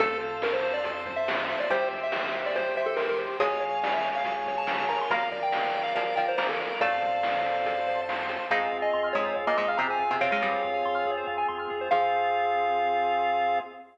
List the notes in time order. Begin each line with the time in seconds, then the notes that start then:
0.00 F2 A3 A4 C5 F5 A5, kick, closed hi-hat
0.20 C5, closed hi-hat
0.42 A#4 F5, snare
0.53 C5
0.63 C5, closed hi-hat
0.74 D5
0.84 A4 C5 A5 C6, kick, closed hi-hat
1.06 C5, kick, closed hi-hat
1.16 E5
1.27 F5, snare
1.49 C5 E5, closed hi-hat
1.60 D5
1.70 C2 G3 G4 C5 E5 G5, kick, closed hi-hat
1.91 C5, kick, closed hi-hat
2.03 E5
2.12 E5, snare
2.34 C5
2.46 D5
2.55 G4 C5 G5 C6, kick, closed hi-hat
2.76 C5 E5, closed hi-hat
2.86 A4
2.96 A#4 E5, snare
3.09 A#4
3.19 C5, closed hi-hat
3.39 C#2 G#3 G#4 C#5 F5 G#5, kick, closed hi-hat
3.61 C#5, closed hi-hat
3.83 D5 F5, snare
3.94 E5
4.04 C#5, closed hi-hat
4.15 F5
4.24 G#4 C#5 G#5 C#6, kick, closed hi-hat
4.46 C#5, kick, closed hi-hat
4.58 A5
4.67 F5, snare
4.89 A#4 A#5, closed hi-hat
5.01 C6
5.10 A#1 A#3 A#4 D5 F5 A#5, kick, closed hi-hat
5.31 D5, kick, closed hi-hat
5.43 G5
5.52 F5, snare
5.74 D5, closed hi-hat
5.83 F5
5.95 F3 F4 A#4 D5 F5 A#5, kick, closed hi-hat
6.16 F3 F4 D5 G5, kick, closed hi-hat
6.28 C5
6.37 A#3 A#4 C5 F5, snare
6.49 A4
6.60 D5, closed hi-hat
6.80 F2 A3 A4 C5 D5 F5 A5, kick, closed hi-hat
7.02 C5, kick, closed hi-hat
7.23 F5, snare
7.44 C5, closed hi-hat
7.65 A4 C5 A5 C6, kick, closed hi-hat
7.88 C5, closed hi-hat
8.09 F5, snare
8.29 C5, closed hi-hat
8.50 F2 G#2 G#3 C4 F4 G#4 F5
8.61 C5
8.72 F2 F5
8.82 D#5 G#5
8.93 F2 C6
9.04 F6
9.13 F2 G#2 G#3 G#4 C#5
9.26 C5
9.36 F2 F5
9.47 A#2 A#3 D#5 G#5
9.57 F2 G#2 G#3 D#5 C6
9.68 F5 F6
9.77 F2 C3 C4 G#4 A#5
9.90 C5 G#5
9.99 F2 F5
10.11 C3 C4 G#5
10.21 F2 C3 C4 C#5 F5 C6
10.32 G#2 G#3 F6
10.42 F2 G2 G3 G#4
10.53 C5
10.63 F2 F5
10.74 G#5
10.85 F2 C6
10.95 F6
11.05 F2 G#4
11.17 C5
11.27 F2 F5
11.38 G#5
11.48 F2 C6
11.59 F6
11.70 F2 G#4
11.81 C5
11.91 F2 F3 C4 F4 G#4 C5 F5